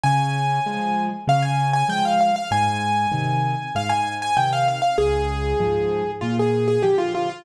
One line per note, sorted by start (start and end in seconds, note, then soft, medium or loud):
0.03 0.59 C#3 loud
0.03 1.04 G#5 medium
0.66 1.09 F3 medium
0.66 1.09 G#3 medium
1.27 1.83 C#3 loud
1.27 1.44 F5 loud
1.43 1.70 G#5 medium
1.73 1.88 G#5 loud
1.88 2.32 F3 medium
1.88 2.32 G#3 medium
1.88 2.04 G5 loud
2.05 2.20 F5 medium
2.21 2.35 F5 medium
2.36 2.51 F5 medium
2.51 3.07 G#2 loud
2.51 3.73 G#5 loud
3.12 3.55 C3 medium
3.12 3.55 D#3 medium
3.75 4.31 G#2 medium
3.75 3.90 F5 medium
3.89 4.15 G#5 medium
4.22 4.37 G#5 medium
4.37 4.80 C3 medium
4.37 4.80 D#3 medium
4.37 4.51 G5 medium
4.53 4.67 F5 loud
4.68 4.81 F5 medium
4.82 4.97 F5 medium
4.98 5.54 C#2 loud
4.98 6.11 G#4 loud
5.60 6.03 G#2 medium
5.60 6.03 F3 medium
6.21 6.78 A#2 medium
6.21 6.36 F4 medium
6.39 6.67 G#4 medium
6.68 6.82 G#4 medium
6.82 7.27 D3 medium
6.82 7.27 F3 medium
6.82 6.97 G4 medium
6.98 7.13 F4 loud
7.15 7.29 F4 medium
7.30 7.44 F4 medium